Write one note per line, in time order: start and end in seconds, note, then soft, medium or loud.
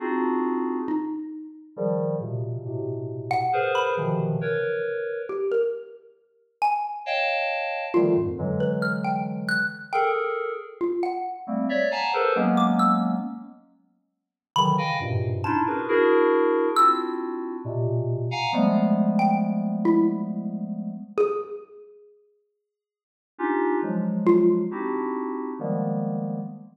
0.00 0.79 C4 medium
0.00 0.79 D4 medium
0.00 0.79 D#4 medium
0.00 0.79 F4 medium
0.00 0.79 F#4 medium
0.00 0.79 G#4 medium
0.88 1.68 D#4 medium
1.76 2.16 C#3 medium
1.76 2.16 D#3 medium
1.76 2.16 F3 medium
1.76 2.16 G3 medium
2.20 2.60 A#2 medium
2.20 2.60 B2 medium
2.20 2.60 C3 medium
2.20 2.60 C#3 medium
2.65 3.44 A2 medium
2.65 3.44 B2 medium
2.65 3.44 C3 medium
3.31 3.71 F#5 loud
3.53 3.92 G#4 medium
3.53 3.92 A#4 medium
3.53 3.92 B4 medium
3.53 3.92 C5 medium
3.75 4.54 B5 medium
3.97 4.37 B2 medium
3.97 4.37 C3 medium
3.97 4.37 C#3 medium
3.97 4.37 D#3 medium
3.97 4.37 E3 medium
3.97 4.37 F3 medium
4.41 5.21 A#4 medium
4.41 5.21 B4 medium
4.41 5.21 C#5 medium
5.29 5.49 G4 medium
5.51 5.71 A#4 medium
6.62 7.01 G#5 medium
7.06 7.85 C#5 medium
7.06 7.85 D#5 medium
7.06 7.85 F5 medium
7.06 7.85 G5 medium
7.06 7.85 A5 medium
7.94 8.14 D3 medium
7.94 8.14 D#3 medium
7.94 8.14 F3 medium
7.94 8.14 G3 medium
7.94 8.14 A3 medium
7.94 8.14 F4 medium
8.16 8.36 F2 medium
8.16 8.36 F#2 medium
8.16 8.36 G#2 medium
8.38 9.57 D3 medium
8.38 9.57 E3 medium
8.38 9.57 F#3 medium
8.38 9.57 G#3 medium
8.60 8.80 B4 medium
8.82 9.02 F6 medium
9.04 9.44 G5 medium
9.49 9.88 F#6 medium
9.93 10.52 G#4 medium
9.93 10.52 A4 medium
9.93 10.52 A#4 medium
9.93 10.13 G5 medium
10.81 11.01 F4 medium
11.03 11.43 F#5 medium
11.47 11.67 G3 medium
11.47 11.67 A3 medium
11.47 11.67 A#3 medium
11.47 11.67 C4 medium
11.69 11.89 C#5 medium
11.69 11.89 D5 medium
11.69 11.89 E5 medium
11.91 12.11 F5 medium
11.91 12.11 F#5 medium
11.91 12.11 G#5 medium
11.91 12.11 A5 medium
11.91 12.11 A#5 medium
12.13 12.33 G#4 medium
12.13 12.33 A4 medium
12.13 12.33 A#4 medium
12.13 12.33 B4 medium
12.13 12.33 C5 medium
12.35 13.15 F#3 loud
12.35 13.15 G#3 loud
12.35 13.15 A#3 loud
12.35 13.15 B3 loud
12.35 13.15 C#4 loud
12.57 12.77 D6 medium
12.79 12.99 E6 medium
14.56 14.76 C#3 medium
14.56 14.76 D3 medium
14.56 14.76 D#3 medium
14.56 14.76 E3 medium
14.56 14.76 F#3 medium
14.56 15.15 B5 loud
14.78 14.98 D#5 medium
14.78 14.98 F5 medium
14.78 14.98 G5 medium
14.78 14.98 G#5 medium
15.00 15.40 F#2 medium
15.00 15.40 G2 medium
15.00 15.40 G#2 medium
15.00 15.40 A#2 medium
15.00 15.40 B2 medium
15.00 15.40 C3 medium
15.44 15.64 C#4 medium
15.44 15.64 D4 medium
15.44 15.64 D#4 medium
15.44 15.64 E4 medium
15.44 15.64 F4 medium
15.44 15.84 A5 medium
15.67 15.86 D4 medium
15.67 15.86 E4 medium
15.67 15.86 F#4 medium
15.67 15.86 G#4 medium
15.67 15.86 A#4 medium
15.67 15.86 B4 medium
15.88 16.68 D4 loud
15.88 16.68 E4 loud
15.88 16.68 F#4 loud
15.88 16.68 G#4 loud
15.88 16.68 A#4 loud
16.76 17.56 C4 medium
16.76 17.56 D4 medium
16.76 17.56 E4 medium
16.76 17.56 F4 medium
16.76 17.56 F#4 medium
16.76 17.56 E6 loud
17.65 18.24 A#2 medium
17.65 18.24 B2 medium
17.65 18.24 C3 medium
18.31 18.51 F5 medium
18.31 18.51 F#5 medium
18.31 18.51 G#5 medium
18.31 18.51 A#5 medium
18.53 20.91 F3 medium
18.53 20.91 G3 medium
18.53 20.91 G#3 medium
18.53 20.91 A3 medium
18.53 20.91 B3 medium
19.19 19.59 G5 medium
19.85 20.05 E4 loud
21.18 23.56 G#4 loud
23.38 23.78 C#4 medium
23.38 23.78 D4 medium
23.38 23.78 D#4 medium
23.38 23.78 F4 medium
23.38 23.78 G4 medium
23.82 24.62 F3 medium
23.82 24.62 F#3 medium
23.82 24.62 G#3 medium
24.26 24.46 F4 loud
24.71 25.50 C4 medium
24.71 25.50 D4 medium
24.71 25.50 D#4 medium
24.71 25.50 E4 medium
24.71 25.50 F#4 medium
24.71 25.50 G4 medium
25.59 26.39 D#3 medium
25.59 26.39 F3 medium
25.59 26.39 G3 medium
25.59 26.39 G#3 medium
25.59 26.39 A#3 medium
25.59 26.39 B3 medium